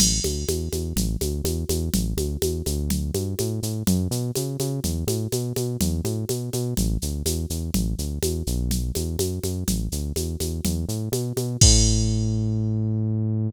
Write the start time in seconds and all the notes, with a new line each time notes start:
0.00 A1, crash, low conga, shaker
0.24 D2, high conga, shaker
0.48 E2, high conga, shaker
0.73 E2, high conga, shaker
0.96 A1, low conga, shaker
1.21 D2, high conga, shaker
1.44 E2, high conga, shaker
1.69 E2, high conga, shaker
1.94 A1, low conga, shaker
2.17 D2, high conga, shaker
2.42 E2, high conga, shaker
2.66 D2, high conga, shaker
2.90 low conga, shaker
3.14 G2, high conga, shaker
3.39 A2, high conga, shaker
3.63 A2, shaker
3.87 F#2, low conga, shaker
4.11 B2, shaker
4.35 C#3, high conga, shaker
4.60 C#3, high conga, shaker
4.84 E2, low conga, shaker
5.07 A2, high conga, shaker
5.32 B2, high conga, shaker
5.56 B2, high conga, shaker
5.81 E2, low conga, shaker
6.04 A2, high conga, shaker
6.29 B2, high conga, shaker
6.53 B2, high conga, shaker
6.77 A1, low conga, shaker
7.02 D2, shaker
7.26 E2, high conga, shaker
7.50 E2, shaker
7.74 A1, low conga, shaker
7.98 D2, shaker
8.22 E2, high conga, shaker
8.47 B1, shaker
8.71 low conga, shaker
8.95 E2, high conga, shaker
9.19 F#2, high conga, shaker
9.43 F#2, high conga, shaker
9.68 A1, low conga, shaker
9.92 D2, shaker
10.16 E2, high conga, shaker
10.40 E2, high conga, shaker
10.65 E2, low conga, shaker
10.89 A2, shaker
11.12 B2, high conga, shaker
11.36 B2, high conga, shaker
11.61 A2, kick, crash